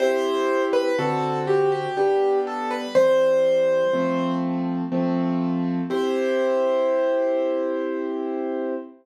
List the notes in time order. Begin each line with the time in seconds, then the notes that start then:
0.00 C4 E4 G4 C5
0.73 B4
0.98 D3 C4 F#4 A4
1.47 G4
1.72 G4
1.97 G3 B3 D4 G4
2.47 A4
2.71 B4
2.95 E3 G3 C4 C5
3.93 F3 A3 C4
4.92 F3 A3 C4
5.90 C4 E4 G4 C5